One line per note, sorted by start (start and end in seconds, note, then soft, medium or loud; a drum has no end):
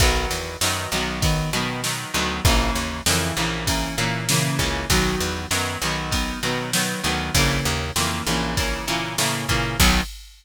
0.00 0.26 B1 medium
0.00 0.57 D#3 medium
0.00 0.57 F#3 loud
0.00 0.57 B3 loud
0.00 kick loud
0.00 ride loud
0.31 0.57 E2 medium
0.31 ride medium
0.61 0.87 F#2 medium
0.61 0.90 D#3 medium
0.61 0.90 F#3 medium
0.61 0.90 B3 medium
0.61 snare loud
0.92 1.44 B1 medium
0.92 1.21 D#3 medium
0.92 1.21 F#3 medium
0.92 1.21 B3 medium
0.92 ride medium
1.22 1.50 D#3 medium
1.22 1.50 F#3 medium
1.22 1.50 B3 medium
1.22 kick loud
1.22 ride loud
1.53 2.05 B2 medium
1.53 1.81 D#3 medium
1.53 1.81 F#3 medium
1.53 1.81 B3 medium
1.53 ride medium
1.84 2.12 D#3 medium
1.84 2.12 F#3 medium
1.84 2.12 B3 medium
1.84 snare loud
2.14 2.40 D2 medium
2.14 2.42 D#3 medium
2.14 2.42 F#3 medium
2.14 2.42 B3 medium
2.14 ride medium
2.45 2.71 A#1 medium
2.45 3.01 C#3 loud
2.45 3.01 E3 loud
2.45 3.01 A#3 loud
2.45 kick loud
2.45 ride loud
2.75 3.01 D#2 medium
2.75 ride medium
3.06 3.32 F2 medium
3.06 3.35 C#3 medium
3.06 3.35 E3 loud
3.06 3.35 A#3 medium
3.06 snare loud
3.36 3.89 A#1 medium
3.36 3.65 C#3 medium
3.36 3.65 E3 medium
3.36 3.65 A#3 medium
3.36 ride medium
3.67 3.95 C#3 medium
3.67 3.95 E3 medium
3.67 3.95 A#3 medium
3.67 kick medium
3.67 ride loud
3.97 4.50 A#2 medium
3.97 4.26 C#3 medium
3.97 4.26 E3 medium
3.97 4.26 A#3 medium
3.97 ride medium
4.29 4.58 C#3 medium
4.29 4.58 E3 medium
4.29 4.58 A#3 medium
4.29 snare loud
4.59 4.85 C#2 medium
4.59 4.87 C#3 medium
4.59 4.87 E3 medium
4.59 4.87 A#3 medium
4.59 kick medium
4.59 ride medium
4.90 5.16 B1 medium
4.90 5.46 D#3 loud
4.90 5.46 F#3 loud
4.90 5.46 B3 medium
4.90 kick medium
4.90 ride loud
5.20 5.46 E2 medium
5.20 ride medium
5.51 5.77 F#2 medium
5.51 5.79 D#3 medium
5.51 5.79 F#3 medium
5.51 5.79 B3 medium
5.51 snare loud
5.82 6.34 B1 medium
5.82 6.11 D#3 medium
5.82 6.11 F#3 medium
5.82 6.11 B3 medium
5.82 ride medium
6.11 6.39 D#3 medium
6.11 6.39 F#3 medium
6.11 6.39 B3 medium
6.11 kick medium
6.11 ride loud
6.43 6.95 B2 medium
6.43 6.71 D#3 medium
6.43 6.71 F#3 loud
6.43 6.71 B3 medium
6.43 ride medium
6.73 7.01 D#3 medium
6.73 7.01 F#3 medium
6.73 7.01 B3 medium
6.73 snare loud
7.04 7.30 D2 medium
7.04 7.32 D#3 medium
7.04 7.32 F#3 medium
7.04 7.32 B3 loud
7.04 ride medium
7.34 7.61 A#1 medium
7.34 7.91 C#3 loud
7.34 7.91 E3 medium
7.34 7.91 A#3 loud
7.34 kick medium
7.34 ride loud
7.65 7.91 D#2 medium
7.65 ride medium
7.96 8.22 F2 medium
7.96 8.24 C#3 medium
7.96 8.24 E3 medium
7.96 8.24 A#3 medium
7.96 snare loud
8.27 8.79 A#1 medium
8.27 8.55 C#3 medium
8.27 8.55 E3 medium
8.27 8.55 A#3 medium
8.27 ride medium
8.57 8.85 C#3 medium
8.57 8.85 E3 medium
8.57 8.85 A#3 medium
8.57 kick loud
8.57 ride loud
8.87 9.17 A#2 medium
8.87 9.16 C#3 medium
8.87 9.16 E3 medium
8.87 9.16 A#3 medium
8.87 ride medium
9.18 9.46 A2 medium
9.18 9.47 C#3 medium
9.18 9.47 E3 medium
9.18 9.47 A#3 medium
9.18 snare loud
9.49 9.77 A#2 medium
9.49 9.77 C#3 medium
9.49 9.77 E3 medium
9.49 9.77 A#3 medium
9.49 kick medium
9.49 ride medium
9.80 10.01 B1 loud
9.80 10.01 D#3 loud
9.80 10.01 F#3 loud
9.80 10.01 B3 loud
9.80 kick loud
9.80 crash loud